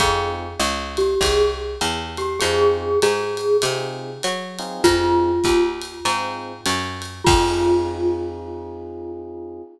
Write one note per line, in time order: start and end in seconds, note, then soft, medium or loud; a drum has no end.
0.00 0.55 F2 loud
0.00 0.46 C4 loud
0.00 0.46 D#4 medium
0.00 0.46 F4 loud
0.00 0.31 G#4 loud
0.00 0.46 G#4 medium
0.00 kick medium
0.00 ride loud
0.59 1.15 C#2 loud
0.59 hi-hat pedal medium
0.59 ride medium
0.97 1.21 G4 loud
0.97 ride medium
1.21 1.76 C2 loud
1.21 1.53 G#4 medium
1.21 kick medium
1.21 ride loud
1.81 2.37 E2 loud
1.81 hi-hat pedal medium
1.81 ride medium
2.17 2.42 G4 loud
2.17 ride medium
2.40 2.97 F2 loud
2.40 2.89 C4 loud
2.40 2.89 D#4 loud
2.40 2.89 F4 medium
2.40 2.99 G#4 loud
2.40 2.89 G#4 medium
2.40 ride loud
3.02 3.58 G#2 medium
3.02 3.57 G#4 loud
3.02 hi-hat pedal medium
3.02 ride loud
3.37 ride medium
3.62 4.18 C3 loud
3.62 4.10 C4 medium
3.62 4.10 D#4 medium
3.62 4.10 F4 medium
3.62 4.10 G#4 medium
3.62 ride loud
4.23 4.80 F#3 medium
4.23 hi-hat pedal medium
4.23 ride medium
4.59 5.30 C4 loud
4.59 5.30 D#4 medium
4.59 5.30 F4 loud
4.59 5.30 G#4 medium
4.59 ride medium
4.84 5.40 F2 loud
4.84 5.71 F4 loud
4.84 kick medium
4.84 ride loud
5.44 6.00 D#2 medium
5.44 kick medium
5.44 hi-hat pedal medium
5.44 ride medium
5.81 ride medium
6.05 6.61 G#2 medium
6.05 6.52 C4 medium
6.05 6.52 D#4 medium
6.05 6.52 F4 medium
6.05 6.52 G#4 medium
6.05 ride loud
6.66 7.22 F#2 loud
6.66 hi-hat pedal medium
6.66 ride loud
7.02 ride medium
7.24 9.60 F2 loud
7.24 9.58 F4 loud
7.24 kick loud
7.28 9.62 C4 medium
7.28 9.62 D#4 loud
7.28 9.62 F4 loud
7.28 9.62 G#4 loud
7.28 crash loud